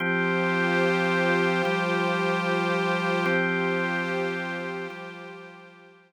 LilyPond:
<<
  \new Staff \with { instrumentName = "Drawbar Organ" } { \time 3/4 \key f \major \tempo 4 = 55 <f c' g'>4. <f g g'>4. | <f c' g'>4. <f g g'>4. | }
  \new Staff \with { instrumentName = "Pad 5 (bowed)" } { \time 3/4 \key f \major <f' g' c''>2. | <f' g' c''>2. | }
>>